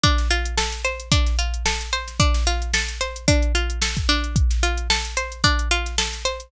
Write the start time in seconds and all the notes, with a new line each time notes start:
0.03 D4, kick, closed hi-hat
0.18 snare, closed hi-hat
0.30 F4, closed hi-hat
0.45 closed hi-hat
0.58 A4, snare
0.72 closed hi-hat
0.84 C5, closed hi-hat
1.00 closed hi-hat
1.12 D4, kick, closed hi-hat
1.26 snare, closed hi-hat
1.39 F4, closed hi-hat
1.54 closed hi-hat
1.66 A4, snare
1.81 closed hi-hat
1.93 C5, closed hi-hat
2.07 snare, closed hi-hat
2.20 D4, kick, closed hi-hat
2.34 snare, closed hi-hat
2.47 F4, closed hi-hat
2.62 closed hi-hat
2.74 A4, snare
2.88 closed hi-hat
3.01 C5, closed hi-hat
3.16 closed hi-hat
3.28 D4, kick, closed hi-hat
3.42 closed hi-hat
3.55 F4, closed hi-hat
3.70 closed hi-hat
3.82 A4, snare
3.97 kick, closed hi-hat
4.09 D4, closed hi-hat
4.24 closed hi-hat
4.36 kick, closed hi-hat
4.50 snare, closed hi-hat
4.63 F4, closed hi-hat
4.77 closed hi-hat
4.90 A4, snare
5.05 closed hi-hat
5.17 C5, closed hi-hat
5.32 closed hi-hat
5.44 D4, kick, closed hi-hat
5.59 closed hi-hat
5.71 F4, closed hi-hat
5.86 snare, closed hi-hat
5.98 A4, snare
6.13 snare, closed hi-hat
6.25 C5, closed hi-hat
6.40 closed hi-hat